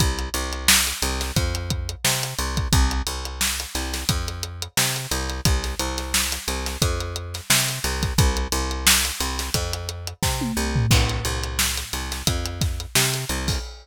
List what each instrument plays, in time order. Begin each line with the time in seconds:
0.00 electric bass (finger) C2, kick, closed hi-hat
0.19 closed hi-hat
0.34 electric bass (finger) C2, closed hi-hat
0.53 closed hi-hat
0.68 snare
0.87 closed hi-hat
1.02 electric bass (finger) C2, closed hi-hat
1.21 snare, closed hi-hat
1.36 electric bass (finger) F2, kick, closed hi-hat
1.55 closed hi-hat
1.70 kick, closed hi-hat
1.89 closed hi-hat
2.05 electric bass (finger) C3, snare
2.23 closed hi-hat
2.39 electric bass (finger) C2, closed hi-hat
2.57 kick, closed hi-hat
2.73 electric bass (finger) C2, kick, closed hi-hat
2.91 closed hi-hat
3.07 electric bass (finger) C2, closed hi-hat
3.25 closed hi-hat
3.41 snare
3.59 snare, closed hi-hat
3.75 electric bass (finger) C2, snare, closed hi-hat
3.93 snare, closed hi-hat
4.09 electric bass (finger) F2, kick, closed hi-hat
4.28 closed hi-hat
4.43 closed hi-hat
4.62 closed hi-hat
4.77 electric bass (finger) C3, snare
4.96 closed hi-hat
5.11 electric bass (finger) C2, closed hi-hat
5.30 closed hi-hat
5.45 electric bass (finger) C2, kick, closed hi-hat
5.64 snare, closed hi-hat
5.79 electric bass (finger) C2, closed hi-hat
5.98 snare, closed hi-hat
6.14 snare
6.32 snare, closed hi-hat
6.48 electric bass (finger) C2, closed hi-hat
6.66 snare, closed hi-hat
6.82 electric bass (finger) F2, kick, closed hi-hat
7.00 closed hi-hat
7.16 closed hi-hat
7.34 snare, closed hi-hat
7.50 electric bass (finger) C3, snare
7.68 snare, closed hi-hat
7.84 electric bass (finger) C2, snare, closed hi-hat
8.03 kick, snare, closed hi-hat
8.18 electric bass (finger) C2, kick, closed hi-hat
8.37 closed hi-hat
8.52 electric bass (finger) C2, closed hi-hat
8.71 closed hi-hat
8.87 snare
9.05 closed hi-hat
9.20 electric bass (finger) C2, closed hi-hat
9.39 snare, closed hi-hat
9.54 electric bass (finger) F2, kick, closed hi-hat
9.73 closed hi-hat
9.89 closed hi-hat
10.07 closed hi-hat
10.23 electric bass (finger) C3, kick, snare
10.41 high tom
10.57 electric bass (finger) C2
10.76 floor tom
10.91 electric bass (finger) C2, kick, crash
11.09 closed hi-hat
11.25 electric bass (finger) C2, closed hi-hat
11.43 closed hi-hat
11.59 snare
11.77 snare, closed hi-hat
11.93 electric bass (finger) C2, snare, closed hi-hat
12.12 snare, closed hi-hat
12.27 electric bass (finger) F2, kick, closed hi-hat
12.46 closed hi-hat
12.61 kick, snare, closed hi-hat
12.80 closed hi-hat
12.95 electric bass (finger) C3, snare
13.14 closed hi-hat
13.29 electric bass (finger) C2, closed hi-hat
13.48 kick, open hi-hat